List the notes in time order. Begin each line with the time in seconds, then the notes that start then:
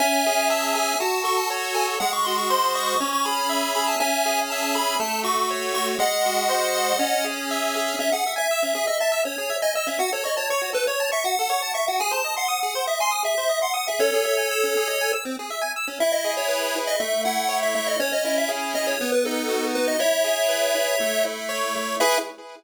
0.00 C#4 E5 G#5
0.26 G#4
0.50 E5 A5
0.62 A5
0.75 G#4 G#5
1.00 F#4 A5
1.24 A4 C#6
1.37 A5
1.50 C#5
1.74 A4 G#5
2.00 G#3 F#5
2.13 C#6
2.25 F#4 C6
2.38 C#6
2.50 C5 C6
2.75 D#5 C#6
2.88 C#6
3.00 C#4
3.13 C#6
3.25 G#4 B5
3.49 E5
3.75 G#4 B5
3.87 A5
4.00 C#4 E5 G#5
4.26 G#4
4.50 E5 A5
4.62 A5
4.75 G#4 B5
5.00 A3 A5
5.24 F#4 C#6
5.38 C#6
5.51 C#5
5.74 F#4 C#6
5.99 G#3 D#5 F#5
6.26 F#4
6.49 C5
6.75 D#5
6.99 C#4
7.24 G#4
7.51 E5
7.75 G#4
7.99 C#4 E5
8.12 G#4 F#5
8.26 E5
8.36 E5 G#5
8.51 E6
8.63 C#4
8.75 G#4
8.87 D#5 E5
9.00 E5 A5
9.12 E6
9.25 C#4 C#5
9.38 G#4
9.50 E5
9.62 D#5 G#5
9.75 D#5 E6
9.87 C#4 E5
9.99 F#4 F#5
10.12 A4 C#5
10.24 C#5 D#5
10.37 C#5 A5
10.50 C#5 C#6
10.62 F#4
10.73 A4 B4
10.87 C#5
11.00 A5
11.12 E5 C#6
11.24 F#4 F#5
11.39 A4
11.50 C#5
11.62 A5
11.74 E5 C#6
11.88 F#4 F#5
12.00 G#4 G#5
12.11 C5 A5
12.24 D#5
12.37 F#5 C6
12.48 D#6
12.63 G#4
12.75 C5
12.87 D#5 E5
13.00 G#5 C6
13.11 D#6
13.23 G#4 E5
13.38 C5
13.49 D#5
13.62 F#5 C6
13.74 F#5 D#6
13.88 G#4 E5
13.99 C#4 A4 C#5
14.13 G#4
14.25 E5
14.37 G#5
14.51 E6
14.63 C#4
14.77 G#4
14.88 D#5
15.01 G#5
15.13 E6
15.25 C4
15.39 G#4
15.50 E5
15.62 G#5
15.76 E6
15.88 C#4
16.00 E4 E5
16.12 D#5
16.25 G#4
16.37 C#5
16.48 B4
16.76 E4
16.87 D#5
17.00 A3 E5
17.25 E4 F#5
17.49 C#5
17.62 E5
17.75 A3 E5
17.87 D#5
17.99 C#4 C#5
18.13 D#5
18.25 E4 D#5
18.38 E5
18.49 G#4
18.74 C#4 D#5
18.87 C#5
19.01 B3
19.12 B4
19.25 D#4 A4
19.49 F#4
19.75 B3 B4
19.88 D#5
19.99 E4 C#5 E5
20.24 G#4
20.48 B4
20.75 E4
21.00 A3
21.25 E4
21.49 C#5
21.76 A3
22.00 E4 G#4 B4 E5